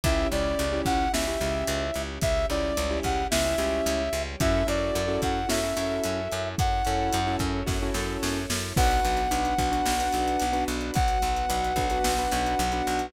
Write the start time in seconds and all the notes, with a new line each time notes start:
0.04 C#2 C#4 E4 G4 E5, kick, closed hi-hat
0.31 C#2 C#4 E4 G4 D5, closed hi-hat
0.59 C#2, closed hi-hat
0.73 C#4 E4 G4
0.85 C#2 F#5, kick, closed hi-hat
1.13 C#2 C#4 E4 G4 E5, snare
1.27 C#4 E4 G4
1.41 C#2 C#4 E4 G4, closed hi-hat
1.67 C#2, closed hi-hat
1.94 C#2, closed hi-hat
2.21 C#2 G3 C#4 G4 E5, kick, closed hi-hat
2.50 C#2 C#4 E4 G4 D5, closed hi-hat
2.77 C#2, closed hi-hat
2.90 C#4 E4 G4
3.03 C#2 F#5, kick, closed hi-hat
3.31 C#2 C#4 E4 G4 E5, snare
3.45 C#4 E4 G4
3.58 C#2 C#4 E4 G4, closed hi-hat
3.86 C#2, closed hi-hat
4.13 C#2, closed hi-hat
4.40 F#2 C#4 E4 F#4 A4 E5, kick, closed hi-hat
4.67 F#2 C#4 E4 F#4 A4 D5, closed hi-hat
4.95 F#2, closed hi-hat
5.08 C#4 E4 F#4 A4
5.22 F#2 F#5, kick, closed hi-hat
5.49 F#2 C#4 E4 F#4 A4 E5, snare
5.64 C#4 E4 F#4 A4
5.76 F#2 C#4 E4 F#4 A4, closed hi-hat
6.04 F#2, closed hi-hat
6.32 F#2, closed hi-hat
6.57 F#2 C#4 E4 A4 C#5 F#5, kick, closed hi-hat
6.85 F#2 C#4 E4 F#4 A4, closed hi-hat
7.13 F#2, closed hi-hat
7.27 C#4 E4 F#4 A4
7.39 F#2, kick, closed hi-hat
7.66 F#2 C#4 E4 F#4 A4, kick, snare
7.82 C#4 E4 F#4 A4
7.94 F#2 C#4 E4 F#4 A4, snare
8.23 F#2, snare
8.50 F#2, snare
8.76 B1 B3 D4 F#4 B4 F#5, kick, crash
8.91 closed hi-hat
9.05 B1, closed hi-hat
9.17 closed hi-hat
9.31 B1 D4 F#4 B4, closed hi-hat
9.45 closed hi-hat
9.58 B1 D4 F#4 B4, kick, closed hi-hat
9.72 D4 F#4 B4, closed hi-hat
9.86 B1, snare
10.00 D4 F#4 B4, closed hi-hat
10.13 B1, closed hi-hat
10.28 closed hi-hat
10.40 B1, closed hi-hat
10.53 D4 F#4 B4, closed hi-hat
10.68 B1, closed hi-hat
10.81 closed hi-hat
10.94 B1 F#3 B3 F#4 F#5, kick, closed hi-hat
11.08 closed hi-hat
11.22 B1, closed hi-hat
11.36 closed hi-hat
11.49 B1 D4 F#4 B4, closed hi-hat
11.64 closed hi-hat
11.76 B1 D4 F#4 B4, kick, closed hi-hat
11.90 D4 F#4 B4, closed hi-hat
12.04 B1, snare
12.18 D4 F#4 B4, closed hi-hat
12.31 B1, closed hi-hat
12.46 closed hi-hat
12.59 B1, closed hi-hat
12.72 D4 F#4 B4, closed hi-hat
12.87 B1, closed hi-hat
12.99 closed hi-hat